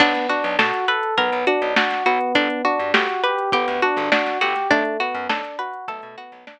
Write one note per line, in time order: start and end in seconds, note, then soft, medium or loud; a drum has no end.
0.00 0.13 B1 loud
0.00 0.27 B3 medium
0.00 0.26 D4 loud
0.00 kick loud
0.00 crash medium
0.15 snare soft
0.15 closed hi-hat medium
0.29 0.55 D4 medium
0.29 0.56 F#4 medium
0.29 closed hi-hat medium
0.44 0.57 B1 medium
0.44 closed hi-hat medium
0.59 0.72 B2 medium
0.59 0.85 F#4 medium
0.59 0.85 A4 medium
0.59 snare loud
0.74 closed hi-hat medium
0.88 1.14 A4 medium
0.88 1.15 B4 medium
0.88 closed hi-hat medium
1.03 closed hi-hat medium
1.17 1.31 B1 medium
1.17 1.44 B3 medium
1.17 1.44 A#4 medium
1.17 kick medium
1.17 closed hi-hat loud
1.32 1.45 B1 medium
1.32 closed hi-hat medium
1.47 1.74 D4 medium
1.47 1.74 F#4 medium
1.47 closed hi-hat medium
1.62 1.75 B1 medium
1.62 closed hi-hat medium
1.76 2.03 D4 medium
1.76 2.03 F#4 medium
1.76 snare loud
1.90 snare medium
1.90 closed hi-hat medium
2.06 2.19 B1 medium
2.06 2.62 B3 medium
2.06 2.32 F#4 medium
2.06 closed hi-hat medium
2.21 closed hi-hat medium
2.35 2.48 G1 loud
2.35 2.62 D4 loud
2.35 kick loud
2.35 closed hi-hat loud
2.50 closed hi-hat medium
2.65 2.91 D4 medium
2.65 2.91 F#4 medium
2.65 closed hi-hat medium
2.79 2.93 G2 medium
2.79 closed hi-hat medium
2.94 3.07 G1 medium
2.94 3.21 F#4 medium
2.94 3.21 G4 medium
2.94 snare loud
3.09 closed hi-hat medium
3.24 3.50 G4 medium
3.24 3.50 B4 medium
3.24 closed hi-hat medium
3.38 closed hi-hat medium
3.52 3.66 G1 medium
3.52 3.80 B3 medium
3.52 3.79 G4 medium
3.52 kick loud
3.52 closed hi-hat loud
3.68 3.81 D2 medium
3.68 snare soft
3.68 closed hi-hat medium
3.82 4.09 D4 medium
3.82 4.09 F#4 medium
3.82 closed hi-hat medium
3.96 4.10 G1 medium
3.96 snare soft
3.96 closed hi-hat medium
4.12 4.38 D4 medium
4.12 4.38 F#4 medium
4.12 snare loud
4.26 snare medium
4.26 closed hi-hat medium
4.41 4.54 G1 medium
4.41 4.68 F#4 medium
4.41 4.68 G4 medium
4.41 snare soft
4.41 closed hi-hat medium
4.56 snare soft
4.56 closed hi-hat medium
4.70 4.84 B1 medium
4.70 4.97 A3 medium
4.70 4.97 D4 loud
4.70 kick loud
4.70 closed hi-hat medium
4.85 closed hi-hat medium
5.00 5.26 B3 medium
5.00 5.26 F#4 medium
5.00 snare soft
5.00 closed hi-hat medium
5.14 5.28 F#2 medium
5.14 closed hi-hat medium
5.29 5.43 B1 medium
5.29 5.56 D4 medium
5.29 5.56 A4 medium
5.29 snare loud
5.44 closed hi-hat medium
5.59 5.85 F#4 medium
5.59 5.85 B4 medium
5.59 closed hi-hat medium
5.73 closed hi-hat medium
5.88 6.01 B1 medium
5.88 6.15 A3 medium
5.88 6.15 A4 medium
5.88 kick medium
5.88 closed hi-hat loud
6.02 6.16 B2 medium
6.02 closed hi-hat medium
6.17 6.44 B3 medium
6.17 6.44 F#4 medium
6.17 snare soft
6.17 closed hi-hat medium
6.32 6.45 B1 medium
6.32 snare soft
6.32 closed hi-hat medium
6.47 6.59 D4 medium
6.47 snare loud